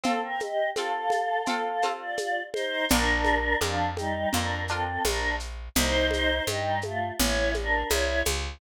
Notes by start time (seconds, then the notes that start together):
0.03 C4 F4 A4 F5, low conga, shaker
0.23 A#4 G5
0.40 G4 D#5, high conga, shaker
0.76 C4 F4 A4 F5, high conga, shaker
1.10 high conga, shaker
1.46 C4 F4 A4 F5, low conga, shaker
1.82 C4 F4 A4, high conga, shaker
1.99 F4 D5
2.17 high conga, shaker
2.53 D#4 C5, high conga, shaker
2.89 A#1 D4 F4 A#4, low conga, shaker
2.93 A#4
3.25 high conga, shaker
3.61 F2 F3 D4 F4 A#4, high conga, shaker
3.97 G3 D#4, high conga, shaker
4.33 F2 D4 F4 A#4, low conga, shaker
4.68 C4 D4 F4 A4, shaker
4.72 A#4
5.05 A#1 D4 A#4, high conga, shaker
5.40 shaker
5.75 C2 D#4 C5, low conga, shaker
6.11 high conga, shaker
6.47 G2 G3 D#4, high conga, shaker
6.82 A3 F4, high conga, shaker
7.18 A1 E4 C#5, low conga, shaker
7.54 D4 A#4, high conga, shaker
7.89 C2 E4 C#5, high conga, shaker
8.25 C#2, high conga, shaker